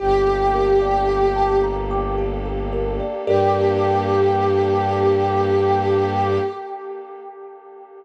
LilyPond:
<<
  \new Staff \with { instrumentName = "Pad 5 (bowed)" } { \time 3/4 \key g \minor \tempo 4 = 55 g'4. r4. | g'2. | }
  \new Staff \with { instrumentName = "Kalimba" } { \time 3/4 \key g \minor g'16 a'16 bes'16 d''16 g''16 a''16 bes''16 d'''16 g'16 a'16 bes'16 d''16 | <g' a' bes' d''>2. | }
  \new Staff \with { instrumentName = "Violin" } { \clef bass \time 3/4 \key g \minor g,,2. | g,2. | }
  \new Staff \with { instrumentName = "Pad 2 (warm)" } { \time 3/4 \key g \minor <bes d' g' a'>2. | <bes d' g' a'>2. | }
>>